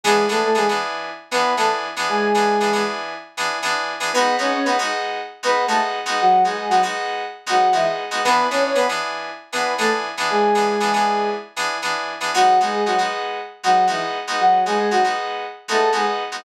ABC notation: X:1
M:4/4
L:1/16
Q:1/4=117
K:G#phr
V:1 name="Ocarina"
[G,G]2 [A,A] [A,A] [G,G] z5 [B,B]2 [A,A] z3 | [G,G]6 z10 | [B,B]2 [Cc] [Cc] [B,B] z5 [B,B]2 [A,A] z3 | [F,F]2 [G,G] [G,G] [F,F] z5 [F,F]2 [E,E] z3 |
[B,B]2 [Cc] [Cc] [B,B] z5 [B,B]2 [A,A] z3 | [G,G]8 z8 | [F,F]2 [G,G] [G,G] [F,F] z5 [F,F]2 [E,E] z3 | [F,F]2 [G,G] [G,G] [F,F] z5 [A,A]2 [G,G] z3 |]
V:2 name="Electric Piano 2"
[E,B,=DG]2 [E,B,DG]2 [E,B,DG] [E,B,DG]5 [E,B,DG]2 [E,B,DG]3 [E,B,DG]- | [E,B,=DG]2 [E,B,DG]2 [E,B,DG] [E,B,DG]5 [E,B,DG]2 [E,B,DG]3 [E,B,DG] | [G,B,DF]2 [G,B,DF]2 [G,B,DF] [G,B,DF]5 [G,B,DF]2 [G,B,DF]3 [G,B,DF]- | [G,B,DF]2 [G,B,DF]2 [G,B,DF] [G,B,DF]5 [G,B,DF]2 [G,B,DF]3 [G,B,DF] |
[E,B,=DG]2 [E,B,DG]2 [E,B,DG] [E,B,DG]5 [E,B,DG]2 [E,B,DG]3 [E,B,DG]- | [E,B,=DG]2 [E,B,DG]2 [E,B,DG] [E,B,DG]5 [E,B,DG]2 [E,B,DG]3 [E,B,DG] | [G,B,DF]2 [G,B,DF]2 [G,B,DF] [G,B,DF]5 [G,B,DF]2 [G,B,DF]3 [G,B,DF]- | [G,B,DF]2 [G,B,DF]2 [G,B,DF] [G,B,DF]5 [G,B,DF]2 [G,B,DF]3 [G,B,DF] |]